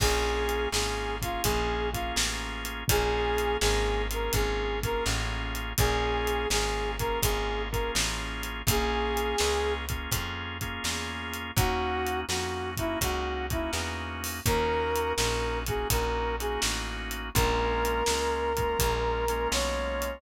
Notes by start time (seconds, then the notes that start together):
0.00 A#1 A#3 C#4 F4 G#4, kick, crash
0.49 closed hi-hat
0.72 G#1 A#3 C#4 F4 G#4, snare
1.22 A#3 C#4 F4 G#4, kick, closed hi-hat
1.43 A#1 A#3 C#4 F4 G#4, kick, closed hi-hat
1.93 A#3 C#4 F4 G#4, kick, closed hi-hat
2.16 A1, snare
2.65 closed hi-hat
2.88 A#1 A#3 C#4 F4 G#4, kick, closed hi-hat
3.38 closed hi-hat
3.61 G#1 A#3 C#4 F4 G#4, snare
4.11 A#3 C#4 F4 G#4 A#4, closed hi-hat
4.33 G#1 A#3 C#4 F4 G#4, kick, closed hi-hat
4.83 A#3 C#4 F4 G#4 A#4, kick, closed hi-hat
5.06 A1, snare
5.55 closed hi-hat
5.78 A#1 A#3 C#4 F4 G#4, kick, closed hi-hat
6.27 closed hi-hat
6.50 G#1 A#3 C#4 F4 G#4, snare
6.99 A#3 C#4 F4 G#4 A#4, kick, closed hi-hat
7.22 G#1 A#3 C#4 F4 G#4, kick, closed hi-hat
7.71 A#3 C#4 F4 G#4 A#4, kick, closed hi-hat
7.95 A1, snare
8.43 closed hi-hat
8.67 A#1 A#3 C#4 F4 G#4, kick, closed hi-hat
9.17 closed hi-hat
9.38 C#2 A#3 C#4 F4 G#4, snare
9.89 A#3 C#4 F4 G#4, kick, closed hi-hat
10.11 F2 A#3 C#4 F4 G#4, kick, closed hi-hat
10.61 A#3 C#4 F4 G#4, kick, closed hi-hat
10.84 E2, snare
11.34 closed hi-hat
11.56 D#2 A#3 C#4 D#4 F#4, kick, closed hi-hat
12.06 closed hi-hat
12.29 F2 A#3 C#4 D#4 F#4, snare
12.77 A#3 C#4 D#4 E4 F#4, kick, closed hi-hat
13.01 C#2 A#3 C#4 D#4 F#4, kick, closed hi-hat
13.50 A#3 C#4 D#4 E4 F#4, kick, closed hi-hat
13.73 E2, snare
14.24 open hi-hat
14.46 D#2 A#3 C#4 D#4 F#4 A#4, kick, closed hi-hat
14.96 closed hi-hat
15.16 A#1 A#3 C#4 D#4 F#4 A#4, snare
15.66 A#3 C#4 D#4 F#4 G#4, kick, closed hi-hat
15.90 A#1 A#3 C#4 D#4 F#4 A#4, kick, closed hi-hat
16.40 A#3 C#4 D#4 F#4 G#4, closed hi-hat
16.62 A1, snare
17.11 closed hi-hat
17.34 A#1 G#3 A#3 C#4 F4 A#4, kick, closed hi-hat
17.85 closed hi-hat
18.06 C#2 G#3 A#3 C#4 F4, snare
18.57 G#3 A#3 C#4 F4, kick, closed hi-hat
18.79 A#1 G#3 A#3 C#4 F4, kick, closed hi-hat
19.28 G#3 A#3 C#4 F4, closed hi-hat
19.52 B1 C#5, snare
20.02 closed hi-hat